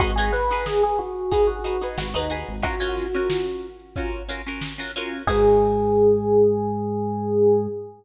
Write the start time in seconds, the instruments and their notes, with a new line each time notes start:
0.00 synth bass 1 G#1, acoustic guitar (steel) D#4 F#4 G#4 B4, electric piano 1 F#4, kick, closed hi-hat
0.16 acoustic guitar (steel) D#4 F#4 G#4 B4, electric piano 1 G#4, closed hi-hat
0.32 electric piano 1 B4, snare, closed hi-hat
0.49 acoustic guitar (steel) D#4 F#4 G#4 B4, closed hi-hat
0.66 electric piano 1 G#4, snare
0.83 electric piano 1 G#4, closed hi-hat
0.99 electric piano 1 F#4, closed hi-hat
1.16 closed hi-hat
1.31 acoustic guitar (steel) D#4 F#4 G#4 B4, electric piano 1 G#4, kick, closed hi-hat
1.47 electric piano 1 F#4, closed hi-hat
1.64 acoustic guitar (steel) D#4 F#4 G#4 B4, closed hi-hat
1.81 acoustic guitar (steel) D#4 F#4 G#4 B4, closed hi-hat
1.98 synth bass 1 G#1, electric piano 1 F#4, snare
2.14 synth bass 1 D#2, acoustic guitar (steel) D#4 F#4 G#4 B4, electric piano 1 D#4, closed hi-hat
2.30 acoustic guitar (steel) D#4 F#4 G#4 B4, closed hi-hat
2.47 synth bass 1 G#1, closed hi-hat
2.63 acoustic guitar (steel) C#4 F4 F#4 A#4, electric piano 1 F#4, kick, closed hi-hat
2.80 acoustic guitar (steel) C#4 F4 F#4 A#4, closed hi-hat
2.97 snare, closed hi-hat
3.13 acoustic guitar (steel) C#4 F4 F#4 A#4, closed hi-hat
3.30 snare
3.46 closed hi-hat
3.63 closed hi-hat
3.79 closed hi-hat
3.96 acoustic guitar (steel) C#4 F4 F#4 A#4, kick, closed hi-hat
4.12 closed hi-hat
4.29 acoustic guitar (steel) C#4 F4 F#4 A#4, closed hi-hat
4.45 acoustic guitar (steel) C#4 F4 F#4 A#4, closed hi-hat
4.61 snare
4.78 acoustic guitar (steel) C#4 F4 F#4 A#4, snare, closed hi-hat
4.95 acoustic guitar (steel) C#4 F4 F#4 A#4, closed hi-hat
5.11 closed hi-hat
5.27 synth bass 1 G#2, acoustic guitar (steel) D#4 F#4 G#4 B4, electric piano 1 G#4, kick, crash